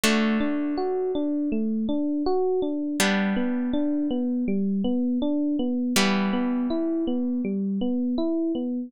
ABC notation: X:1
M:4/4
L:1/8
Q:1/4=81
K:Ador
V:1 name="Electric Piano 1"
A, D F D A, D F D | G, B, D B, G, B, D B, | G, B, E B, G, B, E B, |]
V:2 name="Acoustic Guitar (steel)"
[D,A,F]8 | [G,B,D]8 | [E,G,B,]8 |]